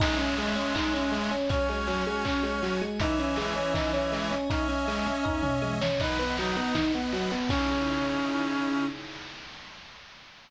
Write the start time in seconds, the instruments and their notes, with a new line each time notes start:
0.00 clarinet G#3, pad 5 (bowed) C#4 D#5 E5 G#5, accordion C#4 D#5, electric piano 1 D#4, kick, crash
0.05 accordion E5 G#5
0.18 electric piano 1 C#4, closed hi-hat
0.37 electric piano 1 G#3, open hi-hat
0.55 electric piano 1 C#4, closed hi-hat
0.74 pad 5 (bowed) C#4 C#5 D#5 G#5, electric piano 1 D#4, kick, clap
0.94 electric piano 1 C#4, closed hi-hat
1.12 electric piano 1 G#3, open hi-hat
1.31 electric piano 1 C#4, closed hi-hat
1.49 clarinet C#4, electric piano 1 C#4, pad 5 (bowed) F#4 C#5 G#5, accordion F#4 C#5, kick, closed hi-hat
1.55 accordion G#5
1.68 electric piano 1 G#3, closed hi-hat
1.87 electric piano 1 F#3, open hi-hat
2.06 electric piano 1 G#3, closed hi-hat
2.24 electric piano 1 C#4, pad 5 (bowed) F#4 G#4 G#5, kick, clap
2.43 electric piano 1 G#3, closed hi-hat
2.63 electric piano 1 F#3, open hi-hat
2.81 electric piano 1 G#3, closed hi-hat
3.00 clarinet E3, pad 5 (bowed) C#4 D#5 E5 G#5, accordion C#4 D#5, electric piano 1 D#4, kick, closed hi-hat
3.05 accordion E5 G#5
3.19 electric piano 1 C#4, closed hi-hat
3.36 electric piano 1 G#3, open hi-hat
3.56 electric piano 1 C#4, closed hi-hat
3.74 pad 5 (bowed) C#4 C#5 D#5 G#5, electric piano 1 D#4, kick, snare
3.93 electric piano 1 C#4, closed hi-hat
4.12 electric piano 1 G#3, open hi-hat
4.31 electric piano 1 C#4, closed hi-hat
4.49 pad 5 (bowed) C#4 D#5 E5 G#5, clarinet C#4, accordion C#4 D#5, electric piano 1 D#4, kick, closed hi-hat
4.55 accordion E5 G#5
4.68 electric piano 1 C#4, closed hi-hat
4.88 electric piano 1 G#3, open hi-hat
5.06 electric piano 1 C#4, closed hi-hat
5.24 pad 5 (bowed) C#4 C#5 D#5 G#5, electric piano 1 D#4, kick, floor tom
5.43 electric piano 1 C#4, mid tom
5.62 electric piano 1 G#3, high tom
5.81 electric piano 1 C#4, snare
6.00 electric piano 1 D#4, accordion B4 D#5, pad 5 (bowed) B4 D#5 F#5, clarinet B4, kick, crash
6.05 accordion F#5
6.19 electric piano 1 B3, closed hi-hat
6.37 electric piano 1 F#3, clarinet D#4, open hi-hat
6.56 electric piano 1 B3, closed hi-hat
6.75 electric piano 1 D#4, pad 5 (bowed) B4 F#5 B5, kick, snare
6.93 electric piano 1 B3, closed hi-hat
7.12 electric piano 1 F#3, open hi-hat
7.31 electric piano 1 B3, open hi-hat
7.49 accordion C#3 D#4, pad 5 (bowed) C#3 D#4 E4 G#4, electric piano 1 C#4, clarinet C#4, kick, crash
7.55 accordion E4 G#4